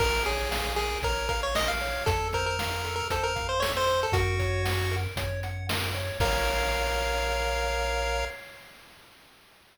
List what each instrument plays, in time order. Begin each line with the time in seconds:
0.00 synth bass 1 A#1, lead 1 (square) A#4, kick, crash
0.26 lead 1 (square) G#4 C#5, closed hi-hat
0.51 lead 1 (square) F5, snare
0.76 lead 1 (square) G#4 A#4, closed hi-hat
1.02 synth bass 1 A#1, lead 1 (square) A#4 C#5, kick, closed hi-hat
1.29 lead 1 (square) A#4 F5, kick, closed hi-hat
1.43 lead 1 (square) C#5
1.55 lead 1 (square) A#4 D#5, snare
1.68 lead 1 (square) F5
1.80 lead 1 (square) C#5, open hi-hat
2.06 synth bass 1 F2, lead 1 (square) A4, kick, closed hi-hat
2.33 lead 1 (square) A#4 C5, kick, closed hi-hat
2.46 lead 1 (square) A#4
2.59 lead 1 (square) F5, snare
2.84 lead 1 (square) A4, closed hi-hat
2.96 lead 1 (square) A#4
3.10 synth bass 1 F2, lead 1 (square) A4 C5, kick, closed hi-hat
3.23 lead 1 (square) A#4
3.36 lead 1 (square) F5, kick, closed hi-hat
3.49 lead 1 (square) C5
3.60 lead 1 (square) A4 C#5, snare
3.77 lead 1 (square) C5
3.87 lead 1 (square) C5, closed hi-hat
4.03 lead 1 (square) A4
4.12 synth bass 1 F#2, lead 1 (square) F#4 A#4, kick, closed hi-hat
4.39 lead 1 (square) C#5, kick, closed hi-hat
4.65 lead 1 (square) F#5, snare
4.91 lead 1 (square) A#4, closed hi-hat
5.16 synth bass 1 F#2, lead 1 (square) C#5, kick, closed hi-hat
5.43 lead 1 (square) F#5, closed hi-hat
5.69 lead 1 (square) A#4, snare
5.95 lead 1 (square) C#5, closed hi-hat
6.20 synth bass 1 A#1, lead 1 (square) A#4 C#5 F5, kick, crash